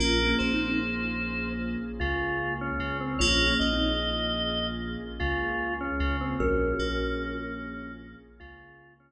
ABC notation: X:1
M:4/4
L:1/16
Q:1/4=75
K:Bbm
V:1 name="Kalimba"
(3[DF]2 [B,D]2 [CE]2 z12 | (3[DF]2 [B,D]2 [CE]2 z12 | [GB]6 z10 |]
V:2 name="Drawbar Organ"
B2 c6 z2 F3 D2 C | d2 e6 z2 F3 D2 C | D8 z2 F3 D2 z |]
V:3 name="Electric Piano 2"
B,2 B,8 D,4 D,2 | B,2 B,8 D,4 D,2 | z2 B,8 D,4 z2 |]
V:4 name="Synth Bass 2" clef=bass
B,,,2 B,,,8 D,,4 D,,2 | B,,,2 B,,,8 D,,4 D,,2 | B,,,2 B,,,8 D,,4 z2 |]
V:5 name="Pad 2 (warm)"
[B,DFA]16 | [B,DFA]16 | [B,DFA]16 |]